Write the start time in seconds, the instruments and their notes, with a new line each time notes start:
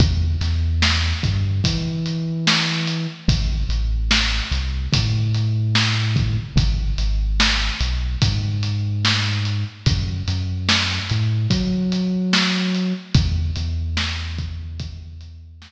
0.00 synth bass 2 E2, kick, closed hi-hat
0.41 synth bass 2 E2, snare, closed hi-hat
0.82 snare
1.23 synth bass 2 G2, kick, closed hi-hat
1.64 synth bass 2 E3, kick, closed hi-hat
2.06 closed hi-hat
2.47 snare
2.87 closed hi-hat
3.28 synth bass 2 A1, kick, closed hi-hat
3.69 synth bass 2 A1, closed hi-hat
4.11 snare
4.52 synth bass 2 C2, snare, closed hi-hat
4.93 synth bass 2 A2, kick, closed hi-hat
5.34 closed hi-hat
5.75 snare
6.16 kick, closed hi-hat
6.56 synth bass 2 G#1, kick, closed hi-hat
6.98 synth bass 2 G#1, closed hi-hat
7.40 snare
7.80 synth bass 2 B1, closed hi-hat
8.22 synth bass 2 G#2, kick, closed hi-hat
8.63 closed hi-hat
9.05 snare
9.45 closed hi-hat
9.86 synth bass 2 F#2, kick, closed hi-hat
10.28 synth bass 2 F#2, closed hi-hat
10.69 snare
11.10 synth bass 2 A2, closed hi-hat
11.50 synth bass 2 F#3, kick, closed hi-hat
11.92 closed hi-hat
12.33 snare
12.74 closed hi-hat
13.15 synth bass 2 E2, kick, closed hi-hat
13.56 synth bass 2 E2, closed hi-hat
13.97 snare
14.38 kick, closed hi-hat
14.79 kick, closed hi-hat
15.21 closed hi-hat
15.62 snare